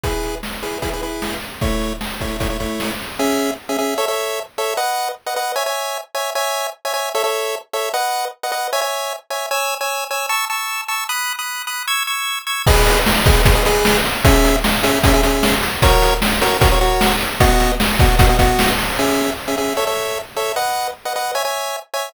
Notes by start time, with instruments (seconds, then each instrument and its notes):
0.04 lead 1 (square) E4 G#4 B4, kick, closed hi-hat
0.23 closed hi-hat
0.43 snare
0.63 lead 1 (square) E4 G#4 B4, closed hi-hat
0.82 lead 1 (square) E4 G#4 B4, kick, closed hi-hat
0.93 lead 1 (square) E4 G#4 B4
1.02 lead 1 (square) E4 G#4 B4, closed hi-hat
1.22 snare
1.42 closed hi-hat
1.61 lead 1 (square) A3 E4 C#5, kick, closed hi-hat
1.81 closed hi-hat
2.01 snare
2.21 lead 1 (square) A3 E4 C#5, kick, closed hi-hat
2.40 lead 1 (square) A3 E4 C#5, kick, closed hi-hat
2.50 lead 1 (square) A3 E4 C#5
2.60 lead 1 (square) A3 E4 C#5, kick, closed hi-hat
2.80 snare
2.99 open hi-hat
3.19 lead 1 (square) C#4 G#4 E5
3.69 lead 1 (square) C#4 G#4 E5
3.79 lead 1 (square) C#4 G#4 E5
3.98 lead 1 (square) A4 C#5 E5
4.08 lead 1 (square) A4 C#5 E5
4.58 lead 1 (square) A4 C#5 E5
4.77 lead 1 (square) B4 D#5 F#5
5.26 lead 1 (square) B4 D#5 F#5
5.36 lead 1 (square) B4 D#5 F#5
5.56 lead 1 (square) C#5 E5 G#5
5.66 lead 1 (square) C#5 E5 G#5
6.15 lead 1 (square) C#5 E5 G#5
6.35 lead 1 (square) C#5 E5 G#5
6.85 lead 1 (square) C#5 E5 G#5
6.94 lead 1 (square) C#5 E5 G#5
7.15 lead 1 (square) A4 C#5 E5
7.24 lead 1 (square) A4 C#5 E5
7.73 lead 1 (square) A4 C#5 E5
7.94 lead 1 (square) B4 D#5 F#5
8.43 lead 1 (square) B4 D#5 F#5
8.52 lead 1 (square) B4 D#5 F#5
8.73 lead 1 (square) C#5 E5 G#5
8.81 lead 1 (square) C#5 E5 G#5
9.30 lead 1 (square) C#5 E5 G#5
9.51 lead 1 (square) C#5 G#5 E6
9.81 lead 1 (square) C#5 G#5 E6
10.11 lead 1 (square) C#5 G#5 E6
10.29 lead 1 (square) A5 C#6 E6
10.50 lead 1 (square) A5 C#6 E6
10.88 lead 1 (square) A5 C#6 E6
11.09 lead 1 (square) B5 D#6 F#6
11.39 lead 1 (square) B5 D#6 F#6
11.67 lead 1 (square) B5 D#6 F#6
11.88 lead 1 (square) C#6 E6 G#6
12.07 lead 1 (square) C#6 E6 G#6
12.47 lead 1 (square) C#6 E6 G#6
12.67 lead 1 (square) G#4 B4 D#5, kick, crash
12.87 closed hi-hat
13.06 snare
13.26 lead 1 (square) G#4 B4 D#5, kick, closed hi-hat
13.45 lead 1 (square) G#4 B4 D#5, kick, closed hi-hat
13.55 lead 1 (square) G#4 B4 D#5
13.65 lead 1 (square) G#4 B4 D#5, closed hi-hat
13.85 snare
14.05 closed hi-hat
14.25 lead 1 (square) C#4 G#4 E5, kick, closed hi-hat
14.44 closed hi-hat
14.64 snare
14.83 lead 1 (square) C#4 G#4 E5, closed hi-hat
15.04 lead 1 (square) C#4 G#4 E5, kick, closed hi-hat
15.13 lead 1 (square) C#4 G#4 E5
15.23 lead 1 (square) C#4 G#4 E5, closed hi-hat
15.43 snare
15.63 closed hi-hat
15.82 lead 1 (square) F#4 A#4 C#5, kick, closed hi-hat
16.02 closed hi-hat
16.22 snare
16.41 lead 1 (square) F#4 A#4 C#5, closed hi-hat
16.61 lead 1 (square) F#4 A#4 C#5, kick, closed hi-hat
16.71 lead 1 (square) F#4 A#4 C#5
16.81 lead 1 (square) F#4 A#4 C#5, closed hi-hat
17.01 snare
17.21 closed hi-hat
17.40 lead 1 (square) B3 F#4 D#5, kick, closed hi-hat
17.60 closed hi-hat
17.80 snare
17.99 lead 1 (square) B3 F#4 D#5, kick, closed hi-hat
18.19 lead 1 (square) B3 F#4 D#5, kick, closed hi-hat
18.29 lead 1 (square) B3 F#4 D#5
18.39 lead 1 (square) B3 F#4 D#5, kick, closed hi-hat
18.59 snare
18.79 open hi-hat
18.99 lead 1 (square) C#4 G#4 E5
19.48 lead 1 (square) C#4 G#4 E5
19.58 lead 1 (square) C#4 G#4 E5
19.77 lead 1 (square) A4 C#5 E5
19.87 lead 1 (square) A4 C#5 E5
20.37 lead 1 (square) A4 C#5 E5
20.56 lead 1 (square) B4 D#5 F#5
21.05 lead 1 (square) B4 D#5 F#5
21.16 lead 1 (square) B4 D#5 F#5
21.35 lead 1 (square) C#5 E5 G#5
21.45 lead 1 (square) C#5 E5 G#5
21.94 lead 1 (square) C#5 E5 G#5